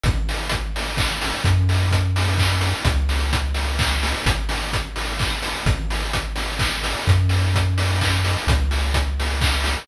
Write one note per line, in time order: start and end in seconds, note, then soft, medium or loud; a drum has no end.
0.03 1.33 G#1 loud
0.03 kick loud
0.03 closed hi-hat loud
0.29 open hi-hat medium
0.49 kick loud
0.49 closed hi-hat loud
0.76 open hi-hat medium
0.97 kick loud
0.97 clap loud
1.21 open hi-hat loud
1.44 2.74 F#2 loud
1.44 kick loud
1.44 closed hi-hat loud
1.69 open hi-hat medium
1.91 kick loud
1.91 closed hi-hat loud
2.16 open hi-hat loud
2.38 kick loud
2.38 clap loud
2.61 open hi-hat loud
2.85 4.15 C#2 loud
2.85 kick loud
2.85 closed hi-hat loud
3.09 open hi-hat medium
3.33 kick loud
3.33 closed hi-hat loud
3.54 open hi-hat medium
3.79 kick loud
3.79 clap loud
4.03 open hi-hat loud
4.26 5.55 G#1 loud
4.26 kick loud
4.26 closed hi-hat loud
4.49 open hi-hat loud
4.73 kick loud
4.73 closed hi-hat loud
4.96 open hi-hat medium
5.19 kick loud
5.19 clap loud
5.42 open hi-hat loud
5.66 6.95 G#1 loud
5.66 kick loud
5.66 closed hi-hat loud
5.90 open hi-hat medium
6.13 kick loud
6.13 closed hi-hat loud
6.36 open hi-hat medium
6.59 kick loud
6.59 clap loud
6.83 open hi-hat loud
7.07 8.37 F#2 loud
7.07 kick loud
7.07 closed hi-hat loud
7.29 open hi-hat medium
7.55 kick loud
7.55 closed hi-hat loud
7.78 open hi-hat loud
8.01 kick loud
8.01 clap loud
8.25 open hi-hat loud
8.47 9.77 C#2 loud
8.47 kick loud
8.47 closed hi-hat loud
8.71 open hi-hat medium
8.94 kick loud
8.94 closed hi-hat loud
9.20 open hi-hat medium
9.41 kick loud
9.41 clap loud
9.64 open hi-hat loud